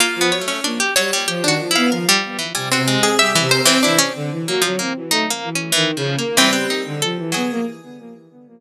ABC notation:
X:1
M:6/4
L:1/16
Q:1/4=94
K:none
V:1 name="Pizzicato Strings"
(3_B,2 =B,2 A,2 D G _G, =G, (3G2 _G2 E2 _B =G,2 E, G, _G _A,2 =G E, B E, | E _D z2 _B, F, B, z (3_E2 B,2 D2 (3=E,2 F,2 B,2 E, =B, _E2 A2 _G,2 |]
V:2 name="Harpsichord"
F z _d _D3 d3 =D2 f5 _a C2 _A e2 c C | D16 C6 _A2 |]
V:3 name="Violin"
z F, _G, z _B, z =G, z F, _E, F, =B, F, z3 (3C,2 C,2 C2 (3G,2 C,2 C2 | E, z D, E, _G, G, C E, A, z E,2 (3_E,2 _D,2 _B,2 =G,3 =D, F, =E, =B, _B, |]